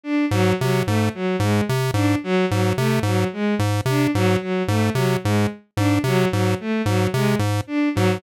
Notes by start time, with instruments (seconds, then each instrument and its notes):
0.04 violin D4
0.31 lead 1 (square) G#2, violin F#3
0.60 lead 1 (square) C3, violin F#3
0.86 lead 1 (square) G#2, violin A3
1.14 violin F#3
1.40 lead 1 (square) G#2, violin G#3
1.69 lead 1 (square) C3
1.94 lead 1 (square) G#2, violin D4
2.24 violin F#3
2.51 lead 1 (square) G#2, violin F#3
2.77 lead 1 (square) C3, violin A3
3.03 lead 1 (square) G#2, violin F#3
3.33 violin G#3
3.59 lead 1 (square) G#2
3.86 lead 1 (square) C3, violin D4
4.15 lead 1 (square) G#2, violin F#3
4.41 violin F#3
4.68 lead 1 (square) G#2, violin A3
4.94 lead 1 (square) C3, violin F#3
5.24 lead 1 (square) G#2, violin G#3
5.77 lead 1 (square) G#2, violin D4
6.04 lead 1 (square) C3, violin F#3
6.32 lead 1 (square) G#2, violin F#3
6.60 violin A3
6.86 lead 1 (square) G#2, violin F#3
7.14 lead 1 (square) C3, violin G#3
7.39 lead 1 (square) G#2
7.67 violin D4
7.95 lead 1 (square) G#2, violin F#3